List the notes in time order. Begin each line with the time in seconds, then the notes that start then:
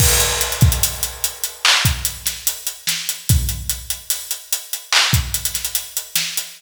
0.00 kick, crash
0.20 closed hi-hat
0.41 closed hi-hat
0.52 closed hi-hat
0.61 kick, closed hi-hat
0.72 closed hi-hat
0.83 closed hi-hat
1.03 closed hi-hat
1.24 closed hi-hat
1.43 closed hi-hat
1.65 clap
1.85 kick, closed hi-hat
2.05 closed hi-hat
2.26 snare, closed hi-hat
2.47 closed hi-hat
2.67 closed hi-hat
2.87 snare, closed hi-hat
3.09 closed hi-hat
3.29 kick, closed hi-hat
3.49 closed hi-hat
3.70 closed hi-hat
3.90 closed hi-hat
4.10 closed hi-hat
4.31 closed hi-hat
4.53 closed hi-hat
4.73 closed hi-hat
4.92 clap
5.13 kick, closed hi-hat
5.34 closed hi-hat
5.45 closed hi-hat
5.54 snare, closed hi-hat
5.65 closed hi-hat
5.75 closed hi-hat
5.97 closed hi-hat
6.16 snare, closed hi-hat
6.37 closed hi-hat